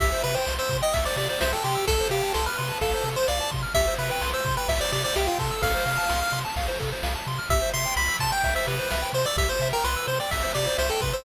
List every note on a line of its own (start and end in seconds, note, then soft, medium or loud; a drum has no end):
0.00 0.13 C2 loud
0.00 0.10 G4 medium
0.00 0.23 E5 loud
0.00 kick medium
0.00 crash medium
0.12 0.22 C5 medium
0.24 0.37 C3 medium
0.24 0.35 B4 loud
0.24 0.35 E5 medium
0.24 ride medium
0.35 0.54 C5 medium
0.35 0.45 G5 medium
0.46 0.60 C2 medium
0.46 0.57 C6 medium
0.46 snare medium
0.59 0.77 C5 medium
0.59 0.69 E6 medium
0.69 0.82 C3 loud
0.69 0.81 C6 medium
0.69 kick medium
0.69 ride medium
0.82 0.94 D#5 loud
0.82 0.92 G5 medium
0.93 1.07 C2 medium
0.93 1.04 E5 medium
0.93 1.05 E5 medium
0.93 kick medium
0.93 ride loud
1.05 1.16 C5 medium
1.05 1.17 D5 loud
1.16 1.29 C3 medium
1.16 1.28 G4 medium
1.16 1.28 D5 loud
1.16 ride medium
1.29 1.39 C5 medium
1.29 1.40 D5 medium
1.41 1.54 C2 loud
1.41 1.52 C5 loud
1.41 1.51 E5 medium
1.41 snare loud
1.52 1.64 A4 medium
1.52 1.63 G5 medium
1.64 1.77 C3 medium
1.64 1.85 G4 medium
1.64 1.75 C6 medium
1.64 ride medium
1.75 1.85 E6 medium
1.87 2.01 C2 loud
1.87 1.98 A4 medium
1.87 2.08 A4 loud
1.87 kick medium
1.87 ride medium
2.00 2.10 C5 medium
2.10 2.23 C3 medium
2.10 2.33 G4 loud
2.10 2.22 F5 medium
2.10 ride medium
2.23 2.33 A5 medium
2.34 2.48 C2 loud
2.34 2.45 A4 medium
2.34 2.45 C6 medium
2.34 snare medium
2.46 2.78 B4 medium
2.46 2.57 F6 medium
2.58 2.72 C3 medium
2.58 2.68 C6 medium
2.58 ride medium
2.69 2.80 A5 medium
2.81 2.94 C2 medium
2.81 3.09 A4 medium
2.81 2.92 F5 medium
2.81 kick medium
2.81 ride medium
2.94 3.04 C5 medium
3.04 3.17 C3 medium
3.04 3.16 A4 medium
3.04 ride medium
3.16 3.27 C5 medium
3.27 3.41 C2 medium
3.27 3.51 D5 medium
3.27 3.39 F5 medium
3.27 snare medium
3.40 3.51 A5 medium
3.51 3.66 C3 loud
3.51 3.62 C6 medium
3.51 kick medium
3.51 ride medium
3.62 3.73 F6 medium
3.74 3.89 C2 loud
3.74 3.86 G4 medium
3.74 3.94 E5 loud
3.74 kick medium
3.74 ride medium
3.87 3.98 C5 medium
3.98 4.11 C3 loud
3.98 4.09 B4 medium
3.98 4.10 E5 medium
3.98 ride medium
4.10 4.30 B4 medium
4.10 4.21 G5 medium
4.21 4.35 C2 medium
4.21 4.32 C6 medium
4.21 snare medium
4.33 4.55 C5 medium
4.33 4.44 E6 medium
4.45 4.58 C3 medium
4.45 4.56 C6 medium
4.45 kick medium
4.45 ride medium
4.57 4.68 B4 medium
4.57 4.67 G5 medium
4.68 4.81 C2 loud
4.68 4.79 E5 medium
4.68 4.80 E5 medium
4.68 kick medium
4.68 ride loud
4.80 4.91 C5 medium
4.80 4.92 D5 loud
4.92 5.05 C3 loud
4.92 5.02 G4 medium
4.92 5.04 D5 medium
4.92 ride medium
5.04 5.15 C5 medium
5.04 5.15 D5 loud
5.16 5.29 C2 loud
5.16 5.27 G4 loud
5.16 5.27 E5 medium
5.16 snare medium
5.27 5.38 F4 medium
5.27 5.38 G5 medium
5.38 5.51 C3 loud
5.38 5.62 A4 medium
5.38 5.50 C6 medium
5.38 kick medium
5.38 ride medium
5.51 5.62 E6 medium
5.62 5.75 C2 loud
5.62 5.72 A4 loud
5.62 6.40 F5 loud
5.62 kick medium
5.62 ride loud
5.74 5.85 C5 medium
5.86 5.99 C3 medium
5.86 5.97 F5 medium
5.86 ride medium
5.97 6.08 A5 medium
6.09 6.23 C2 medium
6.09 6.20 C6 medium
6.09 snare medium
6.21 6.32 F6 medium
6.32 6.45 C3 medium
6.32 6.43 C6 medium
6.32 ride medium
6.45 6.55 A5 medium
6.56 6.69 C2 medium
6.56 6.67 F5 medium
6.56 kick medium
6.56 ride medium
6.68 6.78 C5 medium
6.79 6.93 C3 medium
6.79 6.90 A4 medium
6.79 kick medium
6.79 ride medium
6.92 7.03 C5 medium
7.03 7.16 C2 loud
7.03 7.14 F5 medium
7.03 snare medium
7.15 7.26 A5 medium
7.26 7.40 C3 loud
7.26 7.38 C6 medium
7.26 ride medium
7.38 7.49 F6 medium
7.49 7.62 C2 loud
7.49 7.61 G4 medium
7.49 7.70 E5 loud
7.49 kick loud
7.49 ride medium
7.61 7.72 C5 medium
7.73 7.87 C3 medium
7.73 7.84 E5 medium
7.73 7.94 C6 loud
7.73 ride medium
7.85 7.96 G5 medium
7.96 8.09 C2 loud
7.96 8.17 B5 loud
7.96 8.07 C6 medium
7.96 ride medium
8.08 8.19 E6 medium
8.19 8.32 C3 medium
8.19 8.31 A5 medium
8.19 8.31 C6 medium
8.19 kick medium
8.19 ride medium
8.32 8.42 G5 medium
8.32 8.54 G5 medium
8.44 8.57 C2 medium
8.44 8.54 E5 medium
8.44 kick medium
8.44 ride medium
8.55 8.66 C5 medium
8.55 8.67 E5 loud
8.67 8.80 C3 loud
8.67 8.77 G4 medium
8.67 9.10 B4 medium
8.67 ride medium
8.79 8.90 C5 medium
8.91 9.04 C2 medium
8.91 9.01 E5 medium
8.91 snare medium
9.02 9.12 G5 medium
9.13 9.26 C3 medium
9.13 9.25 C5 medium
9.13 9.24 C6 medium
9.13 ride medium
9.25 9.37 D5 loud
9.25 9.37 E6 medium
9.36 9.49 C2 loud
9.36 9.48 G4 medium
9.36 9.49 E5 loud
9.36 kick medium
9.36 ride medium
9.49 9.68 C5 loud
9.49 9.60 C5 medium
9.60 9.73 C3 loud
9.60 9.72 E5 medium
9.60 ride medium
9.73 9.84 A#4 loud
9.73 9.83 G5 medium
9.84 9.97 C2 loud
9.84 10.06 B4 loud
9.84 9.95 C6 medium
9.84 snare medium
9.96 10.07 E6 medium
10.07 10.20 C3 medium
10.07 10.19 C5 loud
10.07 10.19 C6 medium
10.07 ride medium
10.20 10.31 D5 medium
10.20 10.30 G5 medium
10.31 10.45 C2 medium
10.31 10.52 E5 medium
10.31 10.43 E5 medium
10.31 kick medium
10.31 ride medium
10.43 10.53 C5 medium
10.54 10.68 C3 medium
10.54 10.65 G4 medium
10.54 10.77 D5 medium
10.54 ride medium
10.67 10.77 C5 medium
10.78 10.91 C2 medium
10.78 10.90 C5 medium
10.78 10.88 E5 medium
10.78 snare medium
10.90 11.01 A4 medium
10.90 11.01 G5 medium
11.01 11.14 C3 medium
11.01 11.13 B4 medium
11.01 11.12 C6 medium
11.01 kick medium
11.01 ride medium
11.13 11.24 C5 loud
11.13 11.24 E6 medium